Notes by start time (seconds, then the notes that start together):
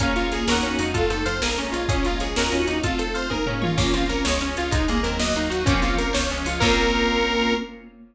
0.00 A#1 A#3 C#4 F4 G#4 A#4 C#5 F5, kick, closed hi-hat
0.04 G#5
0.16 A#1 F4, closed hi-hat
0.32 A#1 G#4, closed hi-hat
0.47 D#2 A#3 C#4 D#4 F#4 A#4 C#5 D#5, snare
0.52 F#5
0.63 D#2 C#4, closed hi-hat
0.79 F2 G#3 D#4, open hi-hat
0.94 A3 C4 F4 A4, kick, closed hi-hat
1.10 F2 C4 D#4 A4 C5, closed hi-hat
1.25 F2 F4 C5 F5, closed hi-hat
1.41 A#1 G#3 A#3 C#4 F4 G#4 A#4, snare
1.57 A#1 A#3 C#4 A#4, closed hi-hat
1.72 A#1 G#3 F4 C#5, closed hi-hat
1.89 A#1 G#3 A#3 C#4 F4 G#4, kick, closed hi-hat
2.03 A#1 A#3 F4 A#4, closed hi-hat
2.19 A#1 C#4 G#4 C#5, closed hi-hat
2.35 D#2 A#3 C#4 D#4 F#4 A#4 C#5 D#5, snare
2.40 F#5
2.52 D#2 C#4, closed hi-hat
2.67 D#2 D#4, closed hi-hat
2.83 A3 C4 F4 A4, kick, closed hi-hat
2.98 C4 A4 C5, closed hi-hat
3.14 F4 C5 F5, closed hi-hat
3.30 G#3 A#3 C#4 D#4 F4 G#4 A#4, kick, high tom
3.46 A#3 C#4 A#4, floor tom
3.61 C#4 F4 C#5, mid tom
3.77 A#1 A#3 C4 C#4 F4, kick, crash
3.93 A#1 C4 C#4 F4, closed hi-hat
4.09 A#1 C#4 A#4, closed hi-hat
4.24 C#2 G#3 C#4 F4 C#5, snare
4.40 C#2 C#4, closed hi-hat
4.56 C#2 F4, closed hi-hat
4.71 C2 G#3 A#3 C4 D#4, kick, closed hi-hat
4.88 C2 A#3 G#4, closed hi-hat
5.03 D#2 F#3 C4 A#4, closed hi-hat
5.19 F#3 A#3 D#4 D#5, snare
5.35 D#2 A#3 D#4, closed hi-hat
5.50 D#2 D#4 F#4, closed hi-hat
5.66 A#1 F3 A#3 C4 C#4, kick, closed hi-hat
5.70 C#4
5.82 A#1 F4, closed hi-hat
5.98 A#1 A#4, closed hi-hat
6.13 C#2 F3 G#3 C#4 C#5, snare
6.29 C#2 G#3 C#4, closed hi-hat
6.44 C#2 C#4 F4, open hi-hat
6.60 A#1 A#3 C4 C#4 F4 A#4, kick, crash
6.64 F4